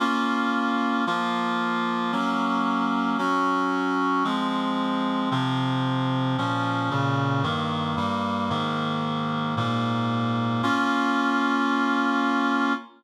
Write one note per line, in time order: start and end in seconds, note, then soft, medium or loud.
0.00 1.05 A#3 medium
0.00 1.05 C#4 medium
0.00 1.05 F4 medium
1.07 2.12 F3 medium
1.07 2.12 A#3 medium
1.07 2.12 F4 medium
2.12 3.17 F#3 medium
2.12 3.17 A#3 medium
2.12 3.17 C#4 medium
3.18 4.24 F#3 medium
3.18 4.24 C#4 medium
3.18 4.24 F#4 medium
4.24 5.30 F3 medium
4.24 5.30 G#3 medium
4.24 5.30 C4 medium
5.31 6.36 C3 medium
5.31 6.36 F3 medium
5.31 6.36 C4 medium
6.38 6.90 A#2 medium
6.38 6.90 F3 loud
6.38 6.90 C#4 medium
6.90 7.43 A#2 medium
6.90 7.43 C#3 medium
6.90 7.43 C#4 medium
7.43 7.96 G2 medium
7.43 7.96 D#3 medium
7.43 7.96 A#3 medium
7.97 8.49 G2 medium
7.97 8.49 G3 medium
7.97 8.49 A#3 medium
8.50 9.55 G#2 medium
8.50 9.55 D#3 medium
8.50 9.55 A#3 medium
9.57 10.62 G#2 medium
9.57 10.62 A#2 medium
9.57 10.62 A#3 medium
10.63 12.73 A#3 medium
10.63 12.73 C#4 loud
10.63 12.73 F4 loud